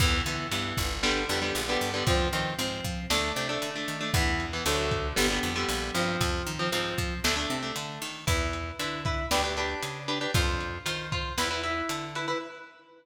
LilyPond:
<<
  \new Staff \with { instrumentName = "Overdriven Guitar" } { \time 4/4 \key e \phrygian \tempo 4 = 116 <e b>8 <e b>8 <e b>4 <d g b>8 <d g b>16 <d g b>8 <d g b>8 <d g b>16 | <f c'>8 <f c'>8 <f c'>4 <a d'>8 <a d'>16 <a d'>8 <a d'>8 <a d'>16 | <e b>8. <e b>16 <d fis a>4 <d g b>16 <d g b>8 <d g b>8. <f c'>8~ | <f c'>8. <f c'>16 <f c'>4 <a d'>16 <a d'>8 <a d'>4~ <a d'>16 |
<e' b'>4 <e' b'>8 <e' b'>8 <d' g' b'>16 <d' g' b'>16 <d' g' b'>4 <d' g' b'>16 <d' g' b'>16 | <f' c''>4 <f' c''>8 <f' c''>8 <e' b'>16 <e' b'>16 <e' b'>4 <e' b'>16 <e' b'>16 | }
  \new Staff \with { instrumentName = "Electric Bass (finger)" } { \clef bass \time 4/4 \key e \phrygian e,8 d8 g,8 g,,4 f,8 bes,,8 g,8 | f,8 dis8 aes,8 f8 d,8 c8 d8 dis8 | e,4 d,4 g,,8 f,8 bes,,8 g,8 | f,8 dis8 aes,8 f8 d,8 c8 d8 dis8 |
e,4 d4 d,4 cis4 | f,4 dis4 e,4 d4 | }
  \new DrumStaff \with { instrumentName = "Drums" } \drummode { \time 4/4 <cymc bd>8 hh8 hh8 <hh bd>8 sn8 hh8 hh8 hho8 | <hh bd>8 hh8 hh8 <hh bd>8 sn8 hh8 hh8 hh8 | <hh bd>8 hh8 hh8 <hh bd>8 sn8 hh8 hh8 hh8 | <hh bd>8 hh8 hh8 <hh bd>8 sn4 hh8 hho8 |
<hh bd>8 hh8 hh8 <hh bd>8 sn8 hh8 hh8 hh8 | <hh bd>8 hh8 hh8 <hh bd>8 sn8 hh8 hh8 hh8 | }
>>